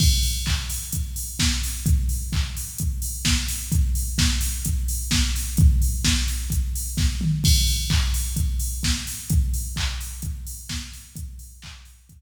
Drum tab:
CC |x-------|--------|--------|--------|
HH |-o-oxo-o|xo-oxo-o|xo-oxo-o|xo-oxo--|
CP |--x-----|--x-----|--------|--------|
SD |------o-|------o-|--o---o-|--o---o-|
T2 |--------|--------|--------|-------o|
BD |o-o-o-o-|o-o-o-o-|o-o-o-o-|o-o-o-o-|

CC |x-------|--------|--------|
HH |-o-oxo-o|xo-oxo-o|xo-ox---|
CP |--x-----|--x-----|--x-----|
SD |------o-|------o-|--------|
T2 |--------|--------|--------|
BD |o-o-o-o-|o-o-o-o-|o-o-o---|